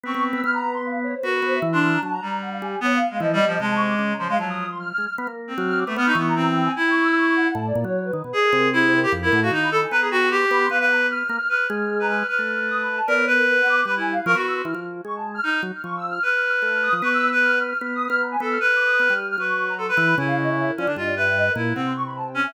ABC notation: X:1
M:2/4
L:1/16
Q:1/4=152
K:none
V:1 name="Clarinet"
C4 | z8 | ^F4 z D3 | z2 G,6 |
B,2 z ^G, (3F,2 =G,2 F,2 | ^G,6 F, G, | ^F,3 z5 | z3 C4 A, |
B, ^D B,2 C4 | E8 | z8 | ^G4 E3 =G |
z E2 ^F ^D2 A z | B ^G ^F2 =G4 | B B3 z4 | B2 z3 B B2 |
B8 | ^A2 B6 | B E2 z ^A ^F3 | z8 |
^D2 z6 | B8 | B3 B3 z2 | z6 A2 |
B6 z2 | B4 A B3 | E6 ^C D | F2 B4 E2 |
C2 z4 ^C2 |]
V:2 name="Drawbar Organ"
B, B,2 B, | B,8 | B,2 B,2 E,4 | ^F,2 z4 G,2 |
z4 E,2 G,2 | C,4 ^C,4 | F,6 ^G, z | B, ^A,3 ^F,3 B, |
B,2 E,6 | z8 | A,,2 ^A,, ^F,3 ^D, B,, | z2 C,6 |
F,,2 A,,2 ^D,4 | B,6 B,2 | B,6 ^A, z | z2 ^G,6 |
z A,7 | B,6 B,2 | G,4 F, B,3 | E, F,3 ^G,4 |
z2 ^F, z =F,4 | z4 A,3 F, | B,8 | B,3 B,3 B,2 |
z4 B, G,3 | ^F,6 E,2 | ^C,6 F, D, | G,,6 ^A,,2 |
C,8 |]
V:3 name="Ocarina"
^c'2 z e' | f' ^a2 c' f2 ^c =c | ^A A c e2 c' f' ^a | a ^a3 ^f =f ^g2 |
^c f3 ^d4 | (3a2 ^c'2 d'2 z ^a =c' f | a ^d'2 c' (3f'2 f'2 f'2 | f' z3 f' f' d'2 |
f' ^c'2 ^a2 g2 ^g | (3g2 ^c'2 e'2 c'2 ^f2 | a d2 ^c2 B3 | d ^A2 A2 c A A |
^A A ^f =f2 b2 ^g | ^a2 g ^f c' d' b c' | f ^f ^a z (3=f'2 f'2 f'2 | f' f'2 f'2 ^a f' f' |
f' f'3 (3^d'2 b2 a2 | d ^c ^A A A ^f d'2 | (3b2 ^g2 f2 ^c'2 e' =c' | f'2 z2 ^c' a2 f' |
f' z2 f' (3^c'2 e'2 f'2 | f' f' f' f'2 f' ^d'2 | ^c' e'2 z (3f'2 f'2 f'2 | (3f'2 ^d'2 f'2 ^a ^g e' f' |
(3f'2 d'2 ^d'2 f'3 f' | ^c'3 ^a =c' b3 | ^g f ^d e2 ^A =d2 | ^d =d e2 (3^d2 ^A2 A2 |
^f c' ^c' b a g ^g e |]